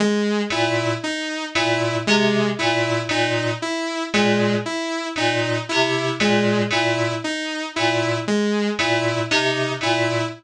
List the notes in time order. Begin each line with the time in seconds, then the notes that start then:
0.00 G#3
0.50 A#2 E4
1.03 D#4
1.55 A#2 E4
2.07 C3 G#3
2.59 A#2 E4
3.09 A#2 D#4
3.62 E4
4.14 A#2 G#3
4.66 E4
5.16 A#2 D#4
5.69 C3 E4
6.20 A#2 G#3
6.70 A#2 E4
7.24 D#4
7.76 A#2 E4
8.28 G#3
8.79 A#2 E4
9.31 C3 D#4
9.81 A#2 E4